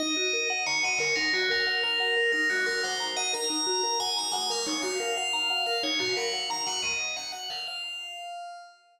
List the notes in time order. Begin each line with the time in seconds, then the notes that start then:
0.00 D#4 D#5
0.17 F#4
0.33 A#4
0.50 F#5
0.66 C#5 A#5
0.83 D#5 F#5
0.98 A#4 C#5
1.16 D#4 A#4
1.33 F#4
1.50 A#4
1.67 F#5
1.83 A#4 A#5
2.00 F#5
2.17 A#4
2.32 D#4 A#4
2.49 F#4
2.66 A#4
2.83 C5 F#5
3.00 A#5
3.17 D#5 F#5
3.33 A#4 A#5
3.50 D#4
3.67 F#4
3.83 A#4
4.00 F#5 G#5
4.17 A#5
4.32 F#5 G#5
4.50 A#4 F5
4.66 D#4 C#5
4.82 F#4 F5
5.00 A#4
5.17 F5 F#5
5.33 A#5
5.50 F#5
5.66 A#4 F5
5.83 D#4 C#5
5.99 F#4 F5
6.17 A#4 F#5
6.33 F#5
6.50 A#5
6.67 F#5
6.83 D#5
7.17 F#5
7.32 F#5
7.50 F5
7.68 F5